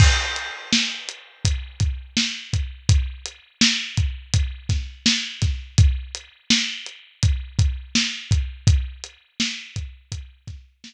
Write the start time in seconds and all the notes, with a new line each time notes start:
0.00 kick, crash
0.36 closed hi-hat
0.73 snare
1.09 closed hi-hat
1.45 kick, closed hi-hat
1.80 kick, closed hi-hat
2.17 snare
2.53 kick, closed hi-hat
2.89 kick, closed hi-hat
3.26 closed hi-hat
3.61 snare
3.97 kick, closed hi-hat
4.34 kick, closed hi-hat
4.69 kick, snare, closed hi-hat
5.06 snare
5.42 kick, snare, closed hi-hat
5.78 kick, closed hi-hat
6.15 closed hi-hat
6.50 snare
6.86 closed hi-hat
7.23 kick, closed hi-hat
7.59 kick, closed hi-hat
7.95 snare
8.31 kick, closed hi-hat
8.67 kick, closed hi-hat
9.04 closed hi-hat
9.40 snare
9.76 kick, closed hi-hat
10.12 kick, closed hi-hat
10.47 kick, snare, closed hi-hat
10.84 snare